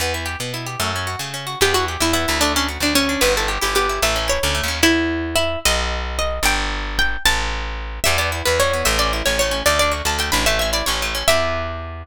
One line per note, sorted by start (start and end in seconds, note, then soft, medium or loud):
0.00 0.36 E2 medium
0.00 0.13 B3 medium
0.14 0.26 E4 medium
0.26 0.38 G4 medium
0.40 0.76 B2 medium
0.40 0.53 B3 medium
0.54 0.66 E4 medium
0.66 0.79 G4 medium
0.80 1.16 F#2 medium
0.80 0.92 A3 medium
0.96 1.08 C#4 medium
1.07 1.19 F#4 medium
1.19 1.56 C#3 medium
1.19 1.33 A3 medium
1.34 1.46 C#4 medium
1.47 1.59 F#4 medium
1.61 1.97 E2 loud
1.61 1.74 B3 loud
1.61 1.73 G4 medium
1.74 1.87 E4 medium
1.74 1.85 F#4 medium
1.88 2.00 G4 medium
2.00 2.26 E2 medium
2.00 2.12 E4 medium
2.00 2.13 E4 medium
2.13 2.26 B3 medium
2.13 2.39 E4 medium
2.28 2.78 D2 loud
2.28 2.40 E4 medium
2.41 2.54 A3 medium
2.41 2.52 D4 medium
2.56 2.67 C#4 medium
2.56 2.69 D4 medium
2.69 2.81 F#4 medium
2.80 3.17 D2 medium
2.80 2.94 D4 medium
2.80 2.93 D4 medium
2.95 3.08 A3 medium
2.95 3.21 C#4 medium
3.09 3.21 D4 medium
3.21 3.58 G1 loud
3.21 3.33 B3 medium
3.21 3.34 B4 medium
3.37 3.49 E4 medium
3.37 3.50 A4 medium
3.48 3.60 G4 medium
3.61 3.99 G1 medium
3.61 3.74 E4 medium
3.61 3.74 G4 medium
3.75 3.87 B3 medium
3.75 4.01 G4 medium
3.89 4.01 E4 medium
4.02 4.39 A1 loud
4.02 4.15 A3 medium
4.02 4.28 E5 medium
4.16 4.28 C#4 medium
4.28 4.40 E4 medium
4.28 4.66 C#5 medium
4.43 4.61 D2 loud
4.43 4.56 C#4 medium
4.55 4.67 A3 medium
4.63 4.82 D#2 medium
4.68 4.80 C#4 medium
4.83 5.57 E2 medium
4.83 5.35 E4 medium
5.36 5.59 E4 medium
5.65 6.39 B1 loud
5.65 6.15 D#5 medium
6.19 6.44 D#5 medium
6.43 7.17 G1 loud
6.43 6.91 G5 medium
6.99 7.23 G5 medium
7.26 8.00 A1 loud
7.26 7.75 A5 medium
8.04 8.43 E2 loud
8.04 8.17 G3 loud
8.04 8.17 E5 medium
8.18 8.31 B3 medium
8.18 8.30 D5 medium
8.32 8.44 E4 medium
8.45 8.83 E2 medium
8.45 8.58 B3 medium
8.45 8.58 B4 medium
8.60 8.72 G3 medium
8.60 8.86 C#5 medium
8.73 8.86 B3 medium
8.85 9.23 A1 loud
8.85 8.97 A3 medium
8.85 8.98 E5 medium
8.99 9.11 C#4 medium
8.99 9.11 D5 medium
9.13 9.25 E4 medium
9.26 9.63 A1 medium
9.26 9.38 C#4 medium
9.26 9.38 C#5 medium
9.39 9.53 A3 medium
9.39 9.61 C#5 medium
9.51 9.63 C#4 medium
9.66 10.02 D2 loud
9.66 9.79 A3 loud
9.66 9.78 D5 medium
9.79 9.94 D4 medium
9.79 9.92 D5 medium
9.92 10.04 F#4 medium
10.05 10.31 D2 medium
10.05 10.17 D4 medium
10.05 10.17 A5 medium
10.19 10.31 A3 medium
10.19 10.31 G5 medium
10.32 10.83 A1 loud
10.32 10.45 D4 medium
10.32 10.44 B5 medium
10.46 10.59 A3 loud
10.46 10.59 E5 medium
10.59 10.74 C#4 medium
10.59 10.70 E5 medium
10.73 10.85 E4 medium
10.73 10.86 D5 medium
10.86 11.24 A1 medium
10.86 11.00 C#4 medium
10.86 11.09 C#5 medium
11.02 11.14 A3 medium
11.15 11.27 C#4 medium
11.28 12.04 E2 medium
11.28 12.03 B3 medium
11.28 12.03 E4 medium
11.28 12.03 G4 loud
11.28 12.03 E5 loud